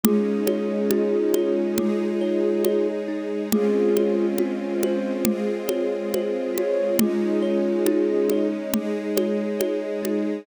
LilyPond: <<
  \new Staff \with { instrumentName = "Flute" } { \time 4/4 \key ees \mixolydian \tempo 4 = 69 <f' aes'>1 | <f' aes'>4 r8 c''8 r4. des''8 | <f' aes'>2 r2 | }
  \new Staff \with { instrumentName = "Kalimba" } { \time 4/4 \key ees \mixolydian aes8 des''8 ees'8 des''8 aes8 des''8 des''8 ees'8 | aes8 des''8 f'8 c''8 aes8 des''8 c''8 f'8 | aes8 des''8 ees'8 des''8 aes8 des''8 des''8 ees'8 | }
  \new Staff \with { instrumentName = "String Ensemble 1" } { \time 4/4 \key ees \mixolydian <aes des' ees'>2 <aes ees' aes'>2 | <aes c' des' f'>2 <aes c' f' aes'>2 | <aes des' ees'>2 <aes ees' aes'>2 | }
  \new DrumStaff \with { instrumentName = "Drums" } \drummode { \time 4/4 cgl8 cgho8 cgho8 cgho8 cgl4 cgho4 | cgl8 cgho8 cgho8 cgho8 cgl8 cgho8 cgho8 cgho8 | cgl4 cgho8 cgho8 cgl8 cgho8 cgho8 cgho8 | }
>>